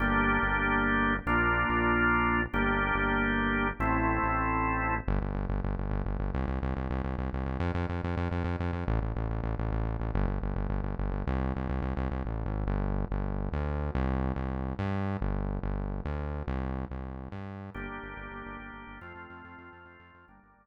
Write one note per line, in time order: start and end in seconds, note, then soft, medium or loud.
0.00 0.39 G1 medium
0.00 1.14 A#3 medium
0.00 1.14 D4 medium
0.00 1.14 G4 medium
0.43 1.20 G1 medium
1.26 1.65 A#1 medium
1.26 2.41 A#3 medium
1.26 2.41 D4 medium
1.26 2.41 F4 medium
1.69 2.47 A#1 medium
2.53 2.92 G1 medium
2.53 3.68 A#3 medium
2.53 3.68 D4 medium
2.53 3.68 G4 medium
2.95 3.73 G1 medium
3.80 4.19 A1 medium
3.80 4.94 A3 medium
3.80 4.94 C4 medium
3.80 4.94 E4 medium
4.23 5.01 A1 medium
5.08 5.20 G1 loud
5.21 5.33 G1 medium
5.35 5.47 G1 medium
5.49 5.61 G1 medium
5.64 5.76 G1 medium
5.78 5.90 G1 medium
5.91 6.03 G1 loud
6.06 6.18 G1 medium
6.20 6.32 G1 medium
6.34 6.46 C2 loud
6.48 6.60 C2 medium
6.62 6.74 C2 medium
6.77 6.89 C2 medium
6.90 7.02 C2 loud
7.04 7.16 C2 medium
7.18 7.30 C2 medium
7.33 7.45 C2 medium
7.46 7.58 C2 medium
7.60 7.72 F2 loud
7.74 7.86 F2 loud
7.89 8.01 F2 medium
8.04 8.16 F2 medium
8.17 8.29 F2 loud
8.31 8.43 F2 medium
8.44 8.56 F2 medium
8.60 8.72 F2 medium
8.73 8.85 F2 medium
8.88 9.00 A1 loud
9.01 9.13 A1 medium
9.16 9.28 A1 medium
9.29 9.41 A1 medium
9.43 9.55 A1 medium
9.59 9.70 A1 medium
9.72 9.84 A1 medium
9.85 9.97 A1 medium
10.00 10.12 A1 medium
10.14 10.26 G1 loud
10.27 10.39 G1 medium
10.42 10.54 G1 medium
10.56 10.68 G1 medium
10.70 10.82 G1 medium
10.84 10.96 G1 medium
10.99 11.11 G1 medium
11.12 11.24 G1 medium
11.27 11.53 C2 loud
11.56 11.68 C2 medium
11.69 11.81 C2 medium
11.82 11.94 C2 medium
11.97 12.09 C2 loud
12.11 12.23 C2 medium
12.25 12.44 A1 medium
12.46 12.65 G#1 medium
12.67 13.05 G1 loud
13.11 13.49 G1 loud
13.52 13.90 D2 medium
13.95 14.33 C2 loud
14.36 14.74 C2 medium
14.79 15.17 G2 medium
15.21 15.59 G1 loud
15.63 16.01 G1 loud
16.05 16.43 D2 loud
16.47 16.85 C2 loud
16.90 17.29 C2 medium
17.32 17.70 G2 medium
17.74 17.87 G1 medium
17.74 18.99 A#3 medium
17.74 18.99 D4 medium
17.74 18.99 G4 medium
17.88 18.00 G1 medium
18.03 18.15 G1 medium
18.17 18.29 G1 medium
18.31 18.43 G1 medium
18.45 18.57 G1 medium
18.59 18.71 G1 medium
18.73 18.85 G1 medium
18.87 18.99 G1 medium
19.01 19.13 F2 medium
19.01 20.26 A3 medium
19.01 20.26 C4 medium
19.01 20.26 F4 medium
19.15 19.27 F2 medium
19.30 19.42 F2 medium
19.44 19.56 F2 medium
19.58 19.70 F2 medium
19.73 19.85 F2 medium
19.85 19.97 F2 medium
19.99 20.11 F2 medium
20.14 20.26 F2 medium
20.28 20.40 G1 medium
20.28 20.66 G3 medium
20.28 20.66 A#3 medium
20.28 20.66 D4 medium
20.42 20.54 G1 medium
20.57 20.66 G1 medium